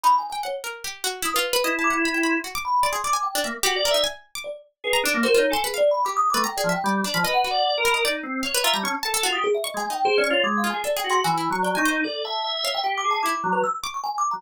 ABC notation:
X:1
M:6/4
L:1/16
Q:1/4=150
K:none
V:1 name="Kalimba"
(3b2 _a2 a2 _d z7 _e' B4 z =d' z3 c' z | z2 b2 c'2 d'2 g2 z4 d2 z4 d z3 | B2 z2 (3_B2 _d2 _a2 (3_A2 =d2 =b2 (3d'2 _e'2 d'2 (3g2 d2 g2 z4 | _e _g4 z b z7 _b a5 z _e' _A =e |
(3_e2 _a2 g2 (3_A2 d2 _d2 (3=d'2 f2 a2 (3=d2 g2 c'2 a a2 z (3d2 _d'2 e2 | A2 a2 z2 _d g (3g2 =d'2 a2 d'3 B e' z _d' d' (3_a2 =d'2 _b2 |]
V:2 name="Drawbar Organ"
z16 E8 | z10 _B, z (3_G2 d2 e2 z8 | _A2 D _B, (3c2 _E2 =A2 z7 A, z2 F, z G,2 d F, | (3B4 d4 _B4 _E2 C2 _d2 =e G, _D z A2 F G z2 |
z _A, z2 (3c2 _D2 F2 A,3 _A z2 _G2 (3E,4 _G,4 _E4 | d2 e2 e4 G2 _A2 E z _G,2 z7 G, |]
V:3 name="Pizzicato Strings"
_E3 g _g2 _B2 =G2 _G2 =E F2 =B (3_e2 a2 g2 b =g b2 | _G d' z2 d _A d _a2 D e2 =G2 _B _E a3 d'3 z2 | z _b D2 _G F z c' =B f3 =G3 B (3_b2 _A2 e2 d2 D =b | _e2 _G2 z2 _B e d z3 f =B F _b _d'2 a A G2 z2 |
(3_d'2 _A2 _E2 z2 d'2 z2 F2 (3=A2 _A2 A2 (3_G2 =E2 d'2 =g _a c2 | z6 f6 E6 d'6 |]